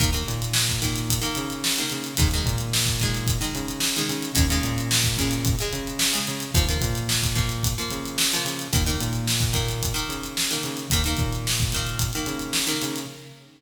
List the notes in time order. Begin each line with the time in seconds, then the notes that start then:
0.00 D#2 D#3 A#3, kick, closed hi-hat
0.13 D#3 A#3, closed hi-hat
0.27 A#2, closed hi-hat
0.42 closed hi-hat
0.53 snare
0.69 kick, closed hi-hat
0.82 D#3 A#3, kick, closed hi-hat
0.96 closed hi-hat
1.10 kick, closed hi-hat
1.21 D#3 A#3, closed hi-hat
1.35 C#3, closed hi-hat
1.50 closed hi-hat
1.64 snare
1.76 D#3 A#3, closed hi-hat
1.90 C#3, closed hi-hat
2.04 closed hi-hat
2.17 D#2 D#3 G#3, kick, closed hi-hat
2.31 D#3, closed hi-hat
2.35 G#3
2.45 A#2, kick, closed hi-hat
2.58 closed hi-hat
2.73 snare
2.86 kick, closed hi-hat
3.00 D#3 G#3, kick, closed hi-hat
3.15 closed hi-hat
3.27 kick, closed hi-hat
3.41 D#3 G#3, closed hi-hat
3.55 C#3, closed hi-hat
3.68 closed hi-hat
3.80 snare
3.96 D#3 G#3, closed hi-hat
4.09 C#3, closed hi-hat
4.23 closed hi-hat
4.35 D#2 C#3 G#3, kick, closed hi-hat
4.50 C#3 G#3, closed hi-hat
4.63 A#2, closed hi-hat
4.78 closed hi-hat
4.91 snare
5.04 kick, closed hi-hat
5.17 C#3 G#3, kick, closed hi-hat
5.31 closed hi-hat
5.45 kick, closed hi-hat
5.59 C#3 G#3, closed hi-hat
5.73 C#3, closed hi-hat
5.87 closed hi-hat
5.99 snare
6.13 C#3 G#3, closed hi-hat
6.27 C#3, closed hi-hat
6.40 closed hi-hat
6.54 D#2 F3 A#3, kick, closed hi-hat
6.68 F3 A#3, closed hi-hat
6.81 A#2, kick, closed hi-hat
6.95 closed hi-hat
7.09 snare
7.23 kick, closed hi-hat
7.35 F3 A#3, kick, closed hi-hat
7.49 closed hi-hat
7.63 kick, closed hi-hat
7.78 F3 A#3, closed hi-hat
7.91 C#3, closed hi-hat
8.05 closed hi-hat
8.18 snare
8.32 F3 A#3, closed hi-hat
8.45 C#3, closed hi-hat
8.59 closed hi-hat
8.73 D#2 D#3 A#3, kick, closed hi-hat
8.86 D#3 A#3, closed hi-hat
9.00 A#2, closed hi-hat
9.13 closed hi-hat
9.27 snare
9.40 kick, closed hi-hat
9.53 D#3 A#3, kick, closed hi-hat
9.69 closed hi-hat
9.83 kick, closed hi-hat
9.94 D#3 A#3, closed hi-hat
10.09 C#3, closed hi-hat
10.23 closed hi-hat
10.37 snare
10.51 D#3 A#3, closed hi-hat
10.63 C#3, closed hi-hat
10.77 closed hi-hat
10.90 D#2 D#3 A#3, kick, closed hi-hat
11.04 D#3 A#3, closed hi-hat
11.17 A#2, kick, closed hi-hat
11.33 closed hi-hat
11.47 snare
11.60 kick, closed hi-hat
11.72 D#3 A#3, kick, closed hi-hat
11.87 closed hi-hat
11.99 kick, closed hi-hat
12.13 D#3 A#3, closed hi-hat
12.26 C#3, closed hi-hat
12.39 closed hi-hat
12.53 snare
12.67 D#3 A#3, closed hi-hat
12.82 C#3, closed hi-hat
12.96 closed hi-hat